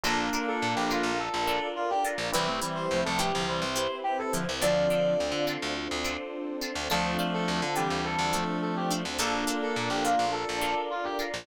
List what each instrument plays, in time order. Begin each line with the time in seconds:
0.03 electric bass (finger) A#1, clarinet A#3 D4, electric piano 1 D4 F4 A4 A#4, pizzicato strings D4 F4 A4 A#4, pad 2 (warm) D4 F4 A4 A#4, brass section A4
0.33 pizzicato strings D4 F4 A4 A#4
0.48 brass section A4
0.62 electric bass (finger) A#2
0.76 electric bass (finger) A#1, brass section G4
0.90 pizzicato strings D4 F4 A4 A#4, brass section F4
1.03 electric bass (finger) A#1
1.19 pad 2 (warm) D4 F4 A#4 D5, brass section A4
1.34 electric bass (finger) A#1
1.47 pizzicato strings D4 F4 A4 A#4
1.76 brass section F4
1.90 brass section G4
2.05 pizzicato strings D4 F4 A4 A#4
2.18 electric bass (finger) A#1
2.33 electric bass (finger) C2, clarinet E3 G3, electric piano 1 C4 E4 G4 B4, pizzicato strings C4 E4 G4 B4, pad 2 (warm) C4 E4 G4 B4, brass section B4
2.47 clarinet A3 C4
2.62 clarinet E3 G3, pizzicato strings C4 E4 G4 B4
2.75 brass section C5
2.91 electric bass (finger) C2, clarinet F3 A3
3.04 electric bass (finger) C2, clarinet F3 A3, brass section A4
3.18 pizzicato strings C4 E4 G4 B4, brass section G4
3.33 electric bass (finger) C2, clarinet D3 F3
3.47 clarinet E3 G3, pad 2 (warm) C4 E4 B4 C5, brass section C5
3.62 electric bass (finger) C2
3.76 pizzicato strings C4 E4 G4 B4
4.04 brass section G4
4.19 brass section A4
4.32 clarinet D3 F3, pizzicato strings C4 E4 G4 B4
4.49 electric bass (finger) C2
4.61 electric bass (finger) D2, clarinet D3 F3, pad 2 (warm) C4 D4 F4 A4, pizzicato strings C4 D4 F4 A4, electric piano 1 C4 D4 F4 A4, brass section D5
4.90 pizzicato strings C4 D4 F4 A4
5.20 electric bass (finger) D2
5.32 electric bass (finger) D3
5.47 pizzicato strings C4 D4 F4 A4
5.62 electric bass (finger) D2
5.76 pad 2 (warm) C4 D4 A4 C5
5.91 electric bass (finger) D2
6.04 pizzicato strings C4 D4 F4 A4
6.61 pizzicato strings C4 D4 F4 A4
6.75 electric bass (finger) D2
6.90 electric bass (finger) D2, clarinet F3 A3, pad 2 (warm) C4 D4 F4 A4, electric piano 1 C4 D4 F4 A4, pizzicato strings D4 F4 A4 C5, brass section A4
7.19 pizzicato strings D4 F4 A4 C5
7.34 brass section A4
7.48 electric bass (finger) D2
7.61 electric bass (finger) D3, brass section A4
7.76 clarinet E3 G3, pizzicato strings D4 F4 A4 C5, brass section G4
7.90 electric bass (finger) D2
8.04 pad 2 (warm) C4 D4 A4 C5, brass section A4
8.19 electric bass (finger) D2
8.33 clarinet F3 A3, pizzicato strings D4 F4 A4 C5
8.62 brass section A4
8.76 brass section G4
8.91 pizzicato strings D4 F4 A4 C5
9.05 electric bass (finger) D2
9.18 electric bass (finger) A#1, clarinet A#3 D4, pizzicato strings D4 F4 A4 A#4, electric piano 1 D4 F4 A4 A#4, pad 2 (warm) D4 F4 A4 A#4, brass section A4
9.47 pizzicato strings D4 F4 A4 A#4
9.63 brass section A4
9.76 electric bass (finger) A#2
9.90 electric bass (finger) A#1, brass section G4
10.04 pizzicato strings D4 F4 A4 A#4, brass section F4
10.19 electric bass (finger) A#1
10.32 pad 2 (warm) D4 F4 A#4 D5, brass section A4
10.49 electric bass (finger) A#1
10.61 pizzicato strings D4 F4 A4 A#4
10.90 brass section F4
11.04 brass section G4
11.19 pizzicato strings D4 F4 A4 A#4
11.34 electric bass (finger) A#1